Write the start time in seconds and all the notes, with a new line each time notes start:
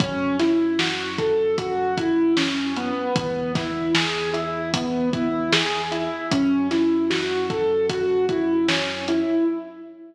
0.00 F#2 C#4, kick, closed hi-hat
0.39 E4, snare, closed hi-hat
0.79 F#4, snare
1.18 A4, kick, closed hi-hat
1.58 F#4, kick, closed hi-hat
1.97 E4, kick, closed hi-hat
2.37 C#4, snare
2.76 B3, closed hi-hat
3.16 E2, kick, closed hi-hat
3.55 E4, kick, snare, closed hi-hat
3.94 G#4, snare
4.33 E4, closed hi-hat
4.74 B3, kick, closed hi-hat
5.13 E4, kick, closed hi-hat
5.52 G#4, snare
5.91 E4, closed hi-hat
6.31 F#2 C#4, kick, closed hi-hat
6.71 E4, snare, closed hi-hat
7.10 F#4, snare
7.50 A4, kick, closed hi-hat
7.89 F#4, kick, closed hi-hat
8.29 E4, kick, closed hi-hat
8.68 C#4, snare
9.08 E4, closed hi-hat